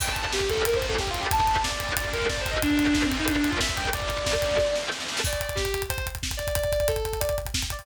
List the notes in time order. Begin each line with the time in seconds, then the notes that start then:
0.00 G2 D3 G3 G5, kick, crash
0.08 G2 D3 G3 A5, kick
0.16 G2 D3 G3, kick, closed hi-hat
0.22 G2 D3 G3 A5, kick
0.33 G4, kick, snare
0.41 G2 D3 G3, kick
0.50 A4, kick, closed hi-hat
0.57 kick
0.65 A2 E3 A3 A#4, kick, closed hi-hat
0.74 A2 E3 A3 C5, kick
0.82 kick, closed hi-hat
0.89 A4, kick
0.98 A2 E3 A3 G4, kick, snare
1.07 F4, kick
1.14 kick, closed hi-hat
1.20 G4, kick
1.31 D2 D3 A3 A5, kick, closed hi-hat
1.39 D2 D3 A3, kick
1.47 D2 D3 A3, kick, closed hi-hat
1.56 D2 D3 A3, kick
1.64 D5, kick, snare
1.71 D2 D3 A3, kick
1.80 kick, closed hi-hat
1.89 kick
1.96 D2 D3 A3 D5, kick, closed hi-hat
2.05 D2 D3 A3, kick
2.13 A#4, kick, closed hi-hat
2.22 kick
2.29 D2 D3 A3 D5, kick, snare
2.38 C5, kick
2.46 kick, closed hi-hat
2.51 D#5, kick
2.62 G2 D3 G3 D4, kick, closed hi-hat
2.70 G2 D3 G3, kick
2.78 G2 D3 G3, kick, closed hi-hat
2.87 G2 D3 G3, kick
2.94 D4, kick, snare
3.03 G2 D3 G3 C4, kick
3.12 kick, closed hi-hat
3.19 D#4, kick
3.27 A2 E3 A3 D4, kick, closed hi-hat
3.35 A2 E3 A3 D4, kick
3.44 kick, closed hi-hat
3.50 F4, kick
3.60 A2 E3 A3 E5, kick, snare
3.69 kick
3.77 G5, kick, closed hi-hat
3.85 kick
3.93 D2 D3 A3 D5, kick, closed hi-hat
4.00 D2 D3 A3, kick
4.09 D2 D3 A3, kick, closed hi-hat
4.18 D2 D3 A3, kick
4.26 kick, snare
4.35 D2 D3 A3, kick
4.42 kick, closed hi-hat
4.51 kick
4.58 D2 D3 A3, kick, snare
4.67 D2 D3 A3
4.75 snare
4.92 D2 D3 A3, snare
5.00 snare
5.08 snare
5.17 snare
5.24 D5, kick, crash
5.33 kick, closed hi-hat
5.40 D5, kick, closed hi-hat
5.49 kick, closed hi-hat
5.55 G4, kick, snare
5.65 kick, closed hi-hat
5.74 kick, closed hi-hat
5.82 kick, closed hi-hat
5.89 C5, kick, closed hi-hat
5.98 kick, closed hi-hat
6.06 kick, closed hi-hat
6.15 kick, closed hi-hat
6.23 kick, snare
6.31 kick, closed hi-hat
6.37 D5, kick, closed hi-hat
6.47 kick, closed hi-hat
6.55 D5, kick, closed hi-hat
6.64 kick, closed hi-hat
6.72 D5, kick, closed hi-hat
6.80 kick, closed hi-hat
6.88 A4, kick, closed hi-hat
6.96 kick, closed hi-hat
7.05 kick, closed hi-hat
7.13 kick, closed hi-hat
7.20 D5, kick, closed hi-hat
7.29 kick, closed hi-hat
7.38 kick, closed hi-hat
7.45 kick, closed hi-hat
7.54 kick, snare
7.62 kick, closed hi-hat
7.70 D5, kick, closed hi-hat
7.79 kick, open hi-hat